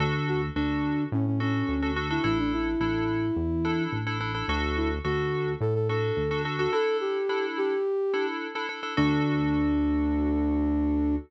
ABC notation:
X:1
M:4/4
L:1/16
Q:1/4=107
K:D
V:1 name="Flute"
z2 F z D4 C C C4 z E | E D E10 z4 | z2 E z F4 A A A4 z F | A2 G4 G6 z4 |
D16 |]
V:2 name="Electric Piano 2"
[DFA]4 [DFA]6 [DFA]3 [DFA] [DFA] [DFA] | [DEA]4 [DEA]6 [DEA]3 [DEA] [DEA] [DEA] | [DFA]4 [DFA]6 [DFA]3 [DFA] [DFA] [DFA] | [DEA]4 [DEA]6 [DEA]3 [DEA] [DEA] [DEA] |
[DFA]16 |]
V:3 name="Synth Bass 1" clef=bass
D,,4 D,,4 A,,4 D,,4 | A,,,4 A,,,4 E,,4 A,,,4 | D,,4 D,,4 A,,4 D,,4 | z16 |
D,,16 |]